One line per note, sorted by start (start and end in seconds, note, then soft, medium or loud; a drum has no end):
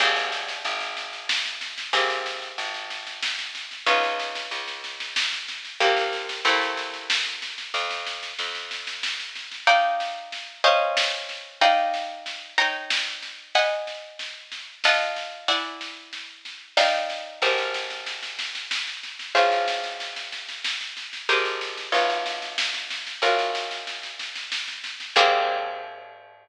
0.00 0.59 G#1 medium
0.00 1.90 A#3 medium
0.00 1.90 C4 medium
0.00 1.90 G4 medium
0.00 1.90 G#4 medium
0.00 kick medium
0.00 snare medium
0.00 crash medium
0.16 snare medium
0.32 snare medium
0.48 snare medium
0.65 1.84 G#1 medium
0.65 snare medium
0.81 snare medium
0.97 snare medium
1.13 snare medium
1.29 snare loud
1.45 snare medium
1.61 snare medium
1.78 snare medium
1.93 2.53 G#1 medium
1.93 3.83 A#3 medium
1.93 3.83 C4 medium
1.93 3.83 G4 medium
1.93 3.83 G#4 medium
1.93 kick loud
1.93 snare medium
2.10 snare medium
2.26 snare medium
2.42 snare medium
2.58 3.77 G#1 medium
2.58 snare medium
2.74 snare medium
2.90 snare medium
3.07 snare medium
3.23 snare loud
3.39 snare medium
3.55 snare medium
3.71 snare medium
3.86 4.46 C#2 medium
3.86 5.76 B3 medium
3.86 5.76 C#4 medium
3.86 5.76 D#4 medium
3.86 5.76 F4 medium
3.86 kick loud
3.86 snare medium
4.03 snare medium
4.19 snare medium
4.35 snare medium
4.51 5.70 C#2 medium
4.51 snare medium
4.67 snare medium
4.84 snare medium
5.00 snare medium
5.16 snare loud
5.32 snare medium
5.48 snare medium
5.65 snare medium
5.80 6.41 C2 medium
5.80 6.44 A#3 medium
5.80 6.44 C4 medium
5.80 6.44 F4 medium
5.80 6.44 G4 medium
5.80 kick medium
5.80 snare medium
5.97 snare medium
6.13 snare medium
6.29 snare medium
6.45 7.64 C2 medium
6.45 7.71 A3 medium
6.45 7.71 A#3 medium
6.45 7.71 C4 medium
6.45 7.71 E4 medium
6.45 snare medium
6.61 snare medium
6.77 snare medium
6.94 snare medium
7.10 snare loud
7.26 snare medium
7.42 snare medium
7.58 snare medium
7.74 8.33 F2 medium
7.74 kick medium
7.74 snare medium
7.90 snare medium
8.07 snare medium
8.23 snare medium
8.39 9.58 F2 medium
8.39 snare medium
8.55 snare medium
8.71 snare medium
8.87 snare medium
9.03 snare medium
9.19 snare medium
9.35 snare medium
9.51 snare medium
9.67 10.59 D#4 loud
9.67 10.59 D5 loud
9.67 10.59 F5 medium
9.67 10.59 G5 medium
9.67 kick medium
9.67 snare medium
10.00 snare medium
10.32 snare medium
10.64 11.60 C#4 loud
10.64 11.60 C5 medium
10.64 11.60 D#5 medium
10.64 11.60 F5 loud
10.64 snare medium
10.97 snare loud
11.29 snare medium
11.61 12.53 D#4 loud
11.61 12.53 D5 medium
11.61 12.53 F5 medium
11.61 12.53 G5 medium
11.61 kick medium
11.61 snare medium
11.94 snare medium
12.26 snare medium
12.58 13.53 D#4 medium
12.58 13.53 C#5 medium
12.58 13.53 G5 medium
12.58 13.53 A#5 loud
12.58 snare medium
12.90 snare loud
13.22 snare medium
13.55 14.82 D#5 medium
13.55 14.82 F#5 loud
13.55 14.82 G#5 medium
13.55 14.82 B5 loud
13.55 kick loud
13.55 snare medium
13.87 snare medium
14.19 snare medium
14.52 snare medium
14.84 15.48 F4 loud
14.84 15.48 D#5 loud
14.84 15.48 F#5 loud
14.84 15.48 A5 medium
14.84 snare loud
15.16 snare medium
15.48 16.75 E4 medium
15.48 16.75 D5 medium
15.48 16.75 F#5 loud
15.48 16.75 G#5 medium
15.48 kick loud
15.48 snare medium
15.81 snare medium
16.13 snare medium
16.45 snare medium
16.77 17.40 D#4 loud
16.77 17.40 D5 loud
16.77 17.40 F5 loud
16.77 17.40 G5 medium
16.77 snare loud
17.10 snare medium
17.42 19.20 G#1 medium
17.42 19.32 G4 medium
17.42 19.32 G#4 medium
17.42 19.32 A#4 medium
17.42 19.32 C5 medium
17.42 kick loud
17.42 snare medium
17.58 snare medium
17.74 snare medium
17.90 snare medium
18.06 snare medium
18.23 snare medium
18.39 snare medium
18.55 snare medium
18.71 snare loud
18.87 snare medium
19.03 snare medium
19.19 snare medium
19.35 21.14 G#1 medium
19.35 21.24 F4 medium
19.35 21.24 G#4 medium
19.35 21.24 C5 medium
19.35 21.24 C#5 medium
19.35 kick medium
19.35 snare medium
19.52 snare medium
19.68 snare medium
19.84 snare medium
20.00 snare medium
20.16 snare medium
20.32 snare medium
20.49 snare medium
20.64 snare medium
20.81 snare medium
20.97 snare medium
21.13 snare medium
21.29 21.88 G#1 medium
21.29 21.92 G4 medium
21.29 21.92 G#4 medium
21.29 21.92 A#4 medium
21.29 21.92 C5 medium
21.29 kick medium
21.29 snare medium
21.45 snare medium
21.61 snare medium
21.77 snare medium
21.92 23.13 G#1 medium
21.92 23.19 F4 medium
21.92 23.19 B4 medium
21.92 23.19 C#5 medium
21.92 23.19 D#5 medium
21.92 snare medium
22.10 snare medium
22.26 snare medium
22.42 snare medium
22.58 snare loud
22.74 snare medium
22.90 snare medium
23.07 snare medium
23.22 25.00 G#1 medium
23.22 25.12 F4 medium
23.22 25.12 F#4 medium
23.22 25.12 A#4 medium
23.22 25.12 C#5 medium
23.22 kick medium
23.22 snare medium
23.39 snare medium
23.55 snare medium
23.71 snare medium
23.87 snare medium
24.03 snare medium
24.19 snare medium
24.35 snare medium
24.52 snare medium
24.68 snare medium
24.84 snare medium
25.00 snare medium
25.16 26.48 G#2 loud
25.16 26.48 A#3 medium
25.16 26.48 C4 loud
25.16 26.48 G4 medium
25.16 26.48 G#4 loud
25.16 kick loud
25.16 crash loud